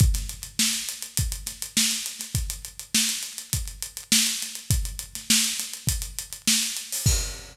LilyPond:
\new DrumStaff \drummode { \time 4/4 \tempo 4 = 102 <hh bd>16 <hh sn>16 hh16 hh16 sn16 hh16 hh16 hh16 <hh bd>16 hh16 <hh sn>16 hh16 sn16 <hh sn>16 hh16 <hh sn>16 | <hh bd>16 hh16 hh16 hh16 sn16 <hh sn>16 hh16 hh16 <hh bd>16 hh16 hh16 hh16 sn16 hh16 <hh sn>16 hh16 | <hh bd>16 hh16 hh16 <hh sn>16 sn16 hh16 <hh sn>16 hh16 <hh bd>16 hh16 hh16 hh16 sn16 hh16 hh16 hho16 | <cymc bd>4 r4 r4 r4 | }